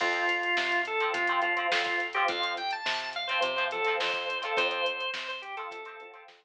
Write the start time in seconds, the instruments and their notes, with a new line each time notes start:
0.00 electric bass (finger) F2, acoustic guitar (steel) F3 C4, drawbar organ F4, kick, crash
0.13 closed hi-hat
0.29 closed hi-hat
0.43 closed hi-hat
0.57 electric bass (finger) C3, snare
0.72 closed hi-hat
0.85 drawbar organ A4, closed hi-hat
1.00 acoustic guitar (steel) F3 C4, closed hi-hat
1.13 electric bass (finger) C3, drawbar organ F4, kick, closed hi-hat
1.27 acoustic guitar (steel) F3 C4, closed hi-hat
1.42 acoustic guitar (steel) F3 C4, drawbar organ F4, closed hi-hat
1.57 acoustic guitar (steel) F3 C4, closed hi-hat
1.72 electric bass (finger) F2, drawbar organ F4, snare
1.84 drawbar organ F4, kick, closed hi-hat
2.00 closed hi-hat
2.13 acoustic guitar (steel) F3 C4, drawbar organ G4, closed hi-hat
2.28 electric bass (finger) F2, drawbar organ F5, kick, closed hi-hat
2.43 closed hi-hat
2.57 drawbar organ G5, closed hi-hat
2.71 drawbar organ A5, closed hi-hat
2.86 electric bass (finger) C3, snare
3.00 closed hi-hat
3.13 drawbar organ F5, closed hi-hat
3.28 acoustic guitar (steel) F3 C4, drawbar organ C5, closed hi-hat
3.41 electric bass (finger) C3, drawbar organ C5, kick, closed hi-hat
3.56 acoustic guitar (steel) F3 C4, closed hi-hat
3.71 acoustic guitar (steel) F3 C4, drawbar organ A4, closed hi-hat
3.85 acoustic guitar (steel) F3 C4, closed hi-hat
4.00 electric bass (finger) F2, drawbar organ C5, snare
4.14 kick, closed hi-hat
4.30 closed hi-hat
4.42 acoustic guitar (steel) F3 C4, drawbar organ A4, closed hi-hat
4.57 electric bass (finger) F2, acoustic guitar (steel) F3 C4, drawbar organ C5, kick, closed hi-hat
4.71 closed hi-hat
4.86 closed hi-hat
5.00 closed hi-hat
5.14 electric bass (finger) C3, drawbar organ C5, snare
5.28 drawbar organ C5, closed hi-hat
5.42 drawbar organ G4, closed hi-hat
5.57 acoustic guitar (steel) F3 C4, drawbar organ A4, closed hi-hat
5.71 electric bass (finger) C3, kick, closed hi-hat
5.85 acoustic guitar (steel) F3 C4, closed hi-hat
6.00 acoustic guitar (steel) F3 C4, closed hi-hat
6.14 acoustic guitar (steel) F3 C4, closed hi-hat
6.28 electric bass (finger) F2, snare
6.43 kick, closed hi-hat